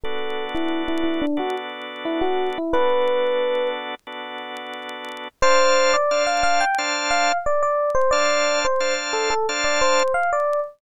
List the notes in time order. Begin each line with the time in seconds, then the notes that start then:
0.04 B3 D4 F#4 A4
0.55 E4
0.88 E4
1.04 E4
1.22 D4
1.37 B3 D4 F#4 A4
2.05 E4
2.21 F#4
2.58 E4
2.73 B3 D4 F#4 A4 B4
4.07 B3 D4 F#4 A4
5.42 D4 C5 F5 A5
5.94 D5
6.11 D4 C5 F5 A5
6.27 F5
6.43 F5
6.61 G5
6.78 D4 C5 F5 A5
7.11 F5
7.46 D5
7.63 D5
7.95 C5
8.11 D4 C5 D5 F5 A5
8.65 C5
8.80 D4 C5 F5 A5
9.13 A4
9.30 A4
9.49 D4 C5 F5 A5
9.64 D5
9.81 C5
10.14 F5
10.33 D5